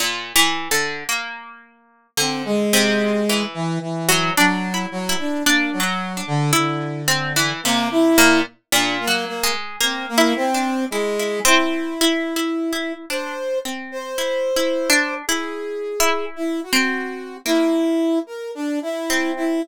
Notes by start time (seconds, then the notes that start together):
0.00 A#2
0.36 E3
0.71 D3
1.09 A#3
2.17 D3 C4
2.45 G#3
2.73 C3
3.29 E3
3.54 E3
3.81 E3
4.09 F#3
4.37 F#3 D4
4.74 E4
4.91 F#3
5.09 E4
5.19 D4
5.45 A#3 D4
5.72 F#3
5.80 F#3
6.17 D4
6.27 D3
6.53 D3 E4
7.08 C4
7.36 E3
7.64 C3 A#3
7.91 E4
8.18 A#2
8.72 A#2 D4
9.00 A#3
9.07 F#3
9.27 A#3
9.43 G#3
9.80 A#3 C4
10.09 A#3
10.18 E4
10.36 C4
10.54 D4
10.90 G#3 E4
11.19 E4
11.45 C4 E4
12.01 E4
12.36 E4
12.72 E4
13.10 D4 C5
13.65 C4
13.92 C5
14.18 E4
14.56 E4
14.90 D4
15.27 E4 G#4
16.00 E4
16.36 E4
16.63 F#4
16.73 C4
17.45 A#3 E4
18.27 A#4
18.55 D4
18.82 E4
19.10 C4
19.36 E4